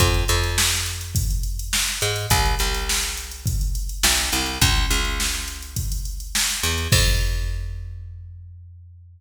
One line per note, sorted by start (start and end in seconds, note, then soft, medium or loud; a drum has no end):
0.00 0.25 F2 loud
0.00 kick medium
0.00 closed hi-hat medium
0.14 closed hi-hat medium
0.28 1.76 F2 loud
0.28 closed hi-hat medium
0.44 closed hi-hat medium
0.58 snare loud
0.72 closed hi-hat medium
0.86 closed hi-hat medium
1.01 closed hi-hat medium
1.15 kick medium
1.15 closed hi-hat loud
1.31 closed hi-hat medium
1.43 closed hi-hat medium
1.59 closed hi-hat medium
1.73 snare loud
1.88 closed hi-hat medium
2.01 2.27 G#2 medium
2.01 closed hi-hat medium
2.16 closed hi-hat medium
2.30 2.55 C2 loud
2.30 kick medium
2.30 closed hi-hat medium
2.46 closed hi-hat medium
2.59 3.97 C2 medium
2.59 closed hi-hat medium
2.74 closed hi-hat medium
2.89 snare loud
3.03 closed hi-hat medium
3.17 closed hi-hat medium
3.31 closed hi-hat medium
3.46 kick medium
3.46 closed hi-hat medium
3.61 closed hi-hat medium
3.75 closed hi-hat medium
3.89 closed hi-hat medium
4.03 4.30 B1 medium
4.03 snare loud
4.18 closed hi-hat medium
4.32 4.59 C2 medium
4.32 closed hi-hat medium
4.46 closed hi-hat medium
4.61 4.86 C#2 loud
4.61 kick loud
4.61 closed hi-hat loud
4.76 closed hi-hat medium
4.91 6.38 C#2 medium
4.91 closed hi-hat medium
5.05 closed hi-hat medium
5.20 snare medium
5.34 closed hi-hat medium
5.48 closed hi-hat medium
5.62 closed hi-hat medium
5.76 kick medium
5.76 closed hi-hat medium
5.92 closed hi-hat medium
6.05 closed hi-hat medium
6.20 closed hi-hat medium
6.35 snare loud
6.50 closed hi-hat medium
6.63 6.88 E2 medium
6.63 closed hi-hat medium
6.78 closed hi-hat medium
6.92 9.21 F2 medium
6.92 kick loud
6.92 crash loud